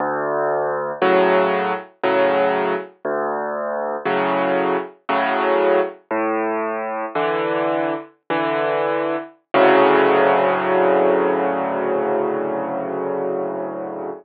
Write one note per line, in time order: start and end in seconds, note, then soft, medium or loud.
0.00 0.92 D2 loud
1.02 1.73 A2 medium
1.02 1.73 C#3 medium
1.02 1.73 F#3 loud
2.03 2.75 A2 medium
2.03 2.75 C#3 medium
2.03 2.75 F#3 medium
3.05 3.96 D2 loud
4.05 4.76 A2 medium
4.05 4.76 C#3 medium
4.05 4.76 F#3 medium
5.09 5.80 A2 medium
5.09 5.80 C#3 medium
5.09 5.80 F#3 medium
6.11 7.05 A2 loud
7.15 7.94 D3 medium
7.15 7.94 E3 medium
8.30 9.16 D3 medium
8.30 9.16 E3 medium
9.54 14.11 D2 loud
9.54 14.11 A2 loud
9.54 14.11 C#3 loud
9.54 14.11 F#3 loud